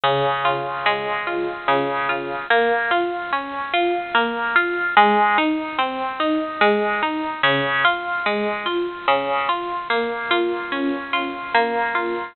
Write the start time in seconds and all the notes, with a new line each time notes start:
0.03 C#3
0.45 F4
0.86 G#3
1.27 F4
1.68 C#3
2.09 F4
2.50 A#3
2.91 F4
3.33 C#4
3.73 F4
4.15 A#3
4.56 F4
4.97 G#3
5.38 D#4
5.78 C4
6.20 D#4
6.61 G#3
7.02 D#4
7.43 C#3
7.85 F4
8.26 G#3
8.66 F4
9.08 C#3
9.49 F4
9.90 A#3
10.31 F4
10.72 C#4
11.13 F4
11.54 A#3
11.95 F4